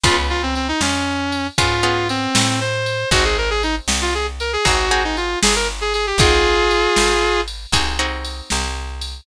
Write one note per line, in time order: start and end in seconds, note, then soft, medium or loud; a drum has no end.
0.04 0.73 C#2 loud
0.04 1.46 B3 medium
0.04 1.46 C#4 medium
0.04 0.16 F4 loud
0.04 1.46 F4 medium
0.04 1.46 G#4 medium
0.04 kick medium
0.04 ride medium
0.30 0.42 F4 loud
0.42 0.55 C4 medium
0.55 0.68 C4 medium
0.55 ride soft
0.68 0.80 D#4 loud
0.81 1.50 F2 medium
0.81 1.47 C#4 loud
0.81 snare medium
1.32 ride medium
1.58 2.27 G#2 medium
1.58 1.82 B3 medium
1.58 1.82 C#4 medium
1.58 2.08 F4 loud
1.58 1.82 F4 medium
1.58 1.82 G#4 medium
1.58 kick medium
1.58 ride medium
1.83 3.01 B3 medium
1.83 3.01 C#4 medium
1.83 3.01 F4 medium
1.83 3.01 G#4 medium
2.09 2.59 C4 loud
2.09 ride medium
2.35 3.05 A2 medium
2.35 snare loud
2.60 3.10 C5 loud
2.86 ride medium
3.11 3.80 G#1 loud
3.11 4.54 C4 medium
3.11 4.54 D#4 medium
3.11 3.24 F#4 loud
3.11 4.54 F#4 medium
3.11 4.54 G#4 medium
3.11 kick medium
3.11 ride medium
3.25 3.37 G#4 loud
3.38 3.50 A#4 loud
3.50 3.62 G#4 loud
3.63 3.75 D#4 loud
3.63 ride medium
3.88 4.57 C2 medium
3.88 snare medium
4.01 4.14 F4 loud
4.14 4.26 G#4 loud
4.40 4.52 A#4 medium
4.40 ride medium
4.53 4.65 G#4 loud
4.65 5.36 G#1 medium
4.65 4.89 C4 medium
4.65 4.89 D#4 medium
4.65 4.89 F#4 medium
4.65 5.03 F#4 loud
4.65 4.89 G#4 medium
4.65 kick medium
4.65 ride medium
4.91 6.09 C4 medium
4.91 6.09 D#4 medium
4.91 6.09 F#4 medium
4.91 6.09 G#4 medium
5.04 5.16 D#4 loud
5.17 5.39 F4 medium
5.17 ride medium
5.42 6.13 G1 medium
5.42 5.55 G#4 loud
5.42 snare loud
5.55 5.68 A#4 loud
5.81 5.93 G#4 loud
5.94 6.06 G#4 loud
5.94 ride medium
6.07 6.19 G4 loud
6.18 6.87 G#1 medium
6.18 7.61 C4 medium
6.18 7.61 D#4 loud
6.18 7.41 F4 loud
6.18 7.61 F#4 medium
6.18 7.41 G#4 loud
6.18 7.61 G#4 medium
6.18 kick loud
6.18 ride loud
6.71 ride medium
6.96 7.66 G#1 medium
6.96 snare medium
7.48 ride medium
7.72 8.42 C2 medium
7.72 7.97 C4 medium
7.72 7.97 D#4 medium
7.72 7.97 F#4 medium
7.72 7.97 G#4 medium
7.72 kick medium
7.72 ride loud
7.99 9.17 C4 medium
7.99 9.17 D#4 medium
7.99 9.17 F#4 medium
7.99 9.17 G#4 medium
8.25 ride medium
8.50 9.21 C2 medium
8.50 snare medium
9.01 ride medium